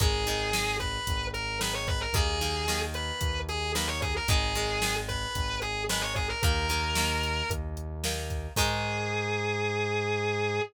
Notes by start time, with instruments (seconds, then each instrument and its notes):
0.00 synth bass 1 G#1, acoustic guitar (steel) D#3 G#3, distortion guitar G#4, kick, closed hi-hat
0.27 acoustic guitar (steel) D#3 G#3, snare, closed hi-hat
0.53 acoustic guitar (steel) D#3 G#3, snare
0.80 distortion guitar B4, kick, closed hi-hat
1.07 synth bass 1 G#1, kick, closed hi-hat
1.33 distortion guitar A#4, closed hi-hat
1.60 acoustic guitar (steel) D#3 G#3, distortion guitar B4, snare
1.74 distortion guitar C#5
1.87 distortion guitar B4, kick, closed hi-hat
2.01 distortion guitar A#4
2.13 synth bass 1 D#2, acoustic guitar (steel) D#3 A#3, distortion guitar G#4, kick, closed hi-hat
2.41 acoustic guitar (steel) D#3 A#3, snare, closed hi-hat
2.68 acoustic guitar (steel) D#3 A#3, snare
2.94 distortion guitar B4, closed hi-hat
3.21 synth bass 1 D#2, kick, closed hi-hat
3.49 distortion guitar G#4, closed hi-hat
3.75 acoustic guitar (steel) D#3 A#3, distortion guitar B4, snare
3.87 distortion guitar C#5
4.02 distortion guitar G#4, kick, closed hi-hat
4.16 distortion guitar A#4
4.28 synth bass 1 G#1, acoustic guitar (steel) D#3 G#3, distortion guitar G#4, kick, closed hi-hat
4.55 acoustic guitar (steel) D#3 G#3, snare, closed hi-hat
4.82 acoustic guitar (steel) D#3 G#3, snare
5.08 distortion guitar B4, kick, closed hi-hat
5.35 synth bass 1 G#1, kick, closed hi-hat
5.62 distortion guitar G#4, closed hi-hat
5.89 acoustic guitar (steel) D#3 G#3, distortion guitar B4, snare
6.01 distortion guitar C#5
6.15 distortion guitar G#4, kick, closed hi-hat
6.29 distortion guitar A#4
6.43 synth bass 1 D#2, acoustic guitar (steel) D#3 A#3, distortion guitar A#4, kick, closed hi-hat
6.69 acoustic guitar (steel) D#3 A#3, snare, closed hi-hat
6.95 acoustic guitar (steel) D#3 A#3, snare
7.23 closed hi-hat
7.49 synth bass 1 D#2, kick, closed hi-hat
7.77 closed hi-hat
8.04 acoustic guitar (steel) D#3 A#3, snare
8.30 kick, closed hi-hat
8.56 synth bass 1 G#2, acoustic guitar (steel) D#3 G#3, distortion guitar G#4, kick, crash